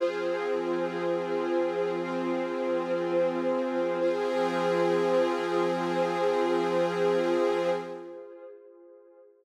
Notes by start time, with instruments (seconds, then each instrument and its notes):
0.00 pad 5 (bowed) F3 C4 G#4, string ensemble 1 F4 G#4 C5
2.00 string ensemble 1 C4 F4 C5
4.00 pad 5 (bowed) F3 C4 G#4, string ensemble 1 F4 G#4 C5